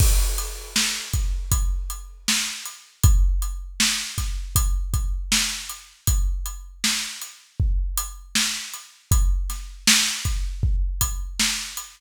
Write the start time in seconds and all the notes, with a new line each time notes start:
0.00 kick, crash
0.38 closed hi-hat
0.76 snare
1.13 kick, closed hi-hat
1.52 kick, closed hi-hat
1.90 closed hi-hat
2.28 snare
2.66 closed hi-hat
3.03 kick, closed hi-hat
3.42 closed hi-hat
3.80 snare
4.18 kick, snare, closed hi-hat
4.56 kick, closed hi-hat
4.94 kick, closed hi-hat
5.32 snare
5.69 closed hi-hat
6.07 kick, closed hi-hat
6.46 closed hi-hat
6.84 snare
7.22 closed hi-hat
7.60 kick
7.97 closed hi-hat
8.35 snare
8.74 closed hi-hat
9.11 kick, closed hi-hat
9.50 snare, closed hi-hat
9.87 snare
10.25 kick, closed hi-hat
10.63 kick
11.01 kick, closed hi-hat
11.40 snare
11.77 closed hi-hat